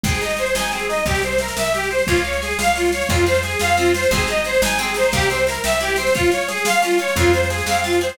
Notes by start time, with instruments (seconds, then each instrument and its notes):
0.04 electric bass (finger) G#1, orchestral harp C4, accordion G#4, kick, snare
0.14 snare
0.21 orchestral harp D#4, accordion D#5, snare
0.30 snare
0.37 orchestral harp G#4, accordion C5, snare
0.46 snare
0.55 electric bass (finger) G#1, orchestral harp D#4, accordion G#5, snare
0.64 snare
0.72 orchestral harp C4, accordion G#4, snare
0.79 snare
0.89 orchestral harp D#4, accordion D#5, snare
0.96 snare
1.06 electric bass (finger) C2, accordion G4, orchestral harp A#4, kick, snare
1.15 snare
1.22 accordion C5, orchestral harp C5, snare
1.32 snare
1.38 accordion A#4, orchestral harp E5, snare
1.48 snare
1.57 electric bass (finger) C2, accordion E5, orchestral harp G5, snare
1.64 snare
1.74 accordion G4, orchestral harp E5, snare
1.83 snare
1.91 orchestral harp C5, accordion C5, snare
1.99 snare
2.07 electric bass (finger) C#2, accordion F4, orchestral harp C#5, kick, snare
2.16 snare
2.24 accordion C#5, orchestral harp F5, snare
2.33 snare
2.42 accordion G#4, orchestral harp G#5, snare
2.51 snare
2.59 electric bass (finger) C#2, accordion F5, orchestral harp F5, snare
2.67 snare
2.76 accordion F4, orchestral harp C#5, snare
2.85 snare
2.92 accordion C#5, orchestral harp F5, snare
3.01 snare
3.09 electric bass (finger) F2, orchestral harp C4, accordion F4, kick, snare
3.17 snare
3.26 orchestral harp F4, accordion C5, snare
3.34 snare
3.43 accordion G#4, orchestral harp G#4, snare
3.51 snare
3.59 electric bass (finger) F2, orchestral harp F4, accordion F5, snare
3.69 snare
3.77 orchestral harp C4, accordion F4, snare
3.85 snare
3.94 orchestral harp F4, accordion C5, snare
4.03 snare
4.11 electric bass (finger) G#1, orchestral harp C4, accordion G#4, kick, snare
4.19 snare
4.27 orchestral harp D#4, accordion D#5, snare
4.37 snare
4.44 orchestral harp G#4, accordion C5, snare
4.53 snare
4.62 electric bass (finger) G#1, orchestral harp D#4, accordion G#5, snare
4.71 snare
4.78 orchestral harp C4, accordion G#4, snare
4.87 snare
4.94 orchestral harp D#4, accordion C5, snare
5.03 snare
5.12 electric bass (finger) C2, orchestral harp A#3, accordion G4, kick, snare
5.21 snare
5.30 orchestral harp C4, accordion C5, snare
5.38 snare
5.47 orchestral harp E4, accordion A#4, snare
5.54 snare
5.64 electric bass (finger) C2, orchestral harp G4, accordion E5, snare
5.73 snare
5.81 orchestral harp E4, accordion G4, snare
5.88 snare
5.96 orchestral harp C4, accordion C5, snare
6.07 snare
6.15 orchestral harp C#4, accordion F4, kick, snare
6.24 snare
6.32 orchestral harp F4, accordion C#5, snare
6.41 snare
6.48 orchestral harp G#4, accordion G#4, snare
6.57 snare
6.65 orchestral harp F4, accordion F5, snare
6.73 snare
6.82 orchestral harp C#4, accordion F4, snare
6.91 snare
6.98 orchestral harp F4, accordion C#5, snare
7.08 snare
7.16 electric bass (finger) F2, orchestral harp C4, accordion F4, kick, snare
7.27 snare
7.33 orchestral harp F4, accordion C5, snare
7.43 snare
7.50 accordion G#4, orchestral harp G#4, snare
7.58 snare
7.66 electric bass (finger) F2, orchestral harp C4, accordion F5, snare
7.75 snare
7.84 accordion F4, orchestral harp F4, snare
7.93 snare
8.01 orchestral harp G#4, accordion C5, snare
8.09 snare